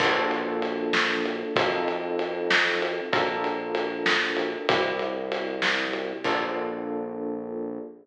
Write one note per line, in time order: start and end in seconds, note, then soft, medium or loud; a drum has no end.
0.00 1.44 A#1 loud
0.00 1.53 A#3 loud
0.00 1.53 D4 medium
0.00 1.53 F4 medium
0.00 1.53 A4 loud
0.00 kick loud
0.00 crash loud
0.31 ride medium
0.62 ride medium
0.93 snare loud
1.26 ride medium
1.56 3.00 F2 loud
1.56 3.09 C4 loud
1.56 3.09 D#4 loud
1.56 3.09 F4 loud
1.56 3.09 A4 medium
1.56 kick loud
1.56 ride loud
1.88 ride medium
2.19 ride medium
2.51 snare loud
2.82 ride medium
3.12 4.56 A#1 loud
3.12 4.66 D4 medium
3.12 4.66 F4 loud
3.12 4.66 A4 loud
3.12 4.66 A#4 loud
3.12 kick loud
3.12 ride loud
3.44 ride medium
3.75 ride loud
4.06 snare loud
4.37 ride medium
4.69 6.13 C2 loud
4.69 6.22 C4 loud
4.69 6.22 E4 medium
4.69 6.22 G4 loud
4.69 kick loud
4.69 ride loud
4.99 ride medium
5.32 ride loud
5.62 snare loud
5.93 ride medium
6.24 7.80 A#1 loud
6.24 7.80 A#3 loud
6.24 7.80 D4 medium
6.24 7.80 F4 loud
6.24 7.80 A4 medium
6.24 kick loud
6.24 crash loud